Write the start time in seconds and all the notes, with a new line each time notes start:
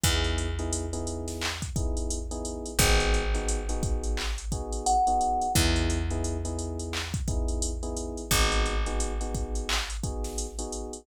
0.04 E2 B3 D#4 E4 G#4, kick, closed hi-hat
0.24 closed hi-hat
0.38 closed hi-hat
0.59 B3 D#4 E4 G#4, closed hi-hat
0.73 closed hi-hat
0.93 B3 D#4 E4 G#4, closed hi-hat
1.07 closed hi-hat
1.28 snare, closed hi-hat
1.42 clap
1.62 kick, closed hi-hat
1.76 B3 D#4 E4 G#4, kick, closed hi-hat
1.97 closed hi-hat
2.10 closed hi-hat
2.31 B3 D#4 E4 G#4, closed hi-hat
2.45 closed hi-hat
2.66 closed hi-hat
2.79 G#1 B3 D#4 F#4 G#4, kick, closed hi-hat
3.00 closed hi-hat
3.14 closed hi-hat
3.34 B3 D#4 F#4 G#4, closed hi-hat
3.49 closed hi-hat
3.69 B3 D#4 F#4 G#4, closed hi-hat
3.83 kick, closed hi-hat
4.04 closed hi-hat
4.17 clap
4.38 closed hi-hat
4.52 B3 D#4 F#4 G#4, kick, closed hi-hat
4.73 closed hi-hat
4.86 F#5, closed hi-hat
5.07 B3 D#4 F#4 G#4, closed hi-hat
5.21 closed hi-hat
5.42 closed hi-hat
5.55 E2 B3 D#4 E4 G#4, kick, closed hi-hat
5.76 closed hi-hat
5.90 closed hi-hat
6.10 B3 D#4 E4 G#4, closed hi-hat
6.24 closed hi-hat
6.45 B3 D#4 E4 G#4, closed hi-hat
6.59 closed hi-hat
6.79 closed hi-hat
6.93 clap
7.14 kick, closed hi-hat
7.28 B3 D#4 E4 G#4, kick, closed hi-hat
7.48 closed hi-hat
7.62 closed hi-hat
7.83 B3 D#4 E4 G#4, closed hi-hat
7.97 closed hi-hat
8.17 closed hi-hat
8.31 G#1 B3 D#4 F#4 G#4, kick, closed hi-hat
8.52 closed hi-hat
8.66 closed hi-hat
8.86 B3 D#4 F#4 G#4, closed hi-hat
9.00 closed hi-hat
9.21 B3 D#4 F#4 G#4, closed hi-hat
9.34 kick, closed hi-hat
9.55 closed hi-hat
9.69 clap
9.90 closed hi-hat
10.04 B3 D#4 F#4 G#4, kick, closed hi-hat
10.24 snare, closed hi-hat
10.38 closed hi-hat
10.59 B3 D#4 F#4 G#4, closed hi-hat
10.72 closed hi-hat
10.93 closed hi-hat